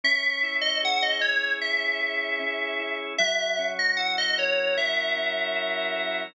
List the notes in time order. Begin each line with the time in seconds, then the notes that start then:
0.04 C#4 E5
0.43 E4
0.61 D#5
0.83 G#4 F#5
1.02 D#5
1.21 C#4 C#5
1.61 E4 E5
2.01 G#4
2.40 C#4
2.79 E4
3.18 F#3 E5
3.59 C#4
3.79 D#5
3.97 E4 F#5
4.18 D#5
4.38 A#4 C#5
4.76 F#3 E5
5.16 C#4
5.56 E4
5.96 A#4